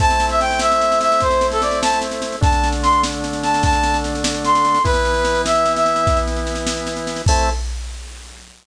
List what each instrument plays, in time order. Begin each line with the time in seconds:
0.00 drawbar organ A3 C4 E4, brass section A5, kick, snare
0.10 snare
0.20 snare
0.29 brass section E5, snare
0.40 brass section G5, snare
0.51 snare
0.59 brass section E5, snare
0.72 snare
0.81 snare
0.92 snare
1.01 brass section E5, snare
1.12 snare
1.20 brass section C5, kick, snare
1.30 snare
1.41 snare
1.52 brass section A4, snare
1.61 brass section D5, snare
1.71 snare
1.82 brass section A5, snare
1.93 snare
2.01 snare
2.11 snare
2.22 snare
2.32 snare
2.41 drawbar organ D3 A3 D4, brass section A5, kick, snare
2.52 snare
2.64 snare
2.72 snare
2.83 brass section C6, snare
2.92 snare
3.03 snare
3.13 snare
3.24 snare
3.33 snare
3.43 brass section A5, snare
3.54 snare
3.63 brass section A5, kick, snare
3.73 snare
3.84 snare
3.94 snare
4.04 snare
4.15 snare
4.24 snare
4.34 snare
4.44 brass section C6, snare
4.55 snare
4.65 snare
4.74 snare
4.84 drawbar organ E3 B3 E4, brass section B4, kick, snare
4.94 snare
5.05 snare
5.14 snare
5.25 snare
5.35 snare
5.46 brass section E5, snare
5.55 snare
5.66 snare
5.76 brass section E5, snare
5.86 snare
5.96 snare
6.07 kick, snare
6.17 snare
6.27 snare
6.36 snare
6.47 snare
6.55 snare
6.67 snare
6.77 snare
6.87 snare
6.96 snare
7.07 snare
7.16 snare
7.26 drawbar organ A3 C4 E4, brass section A5, kick, crash